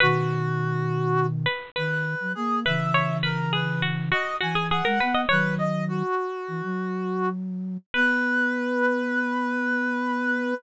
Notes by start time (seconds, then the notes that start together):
0.00 B2 D#3 F#4 B4
1.46 B4
1.76 D#3 B4
2.20 F#3
2.35 A#3 G#4
2.65 C#3 E3 B4 E5
2.94 C#5
3.23 A#4 B4
3.53 G#4 B4
3.82 F#4
4.11 F#4 D#5
4.41 E3 F#4 G#5
4.55 G#4
4.70 G#4 F#5
4.85 G#3 A#4
5.00 B3 B4
5.14 D#5
5.29 D#3 F#3 B4 C#5
5.58 D#5
5.88 F#4
6.48 E3
6.63 F#3
7.94 B3 B4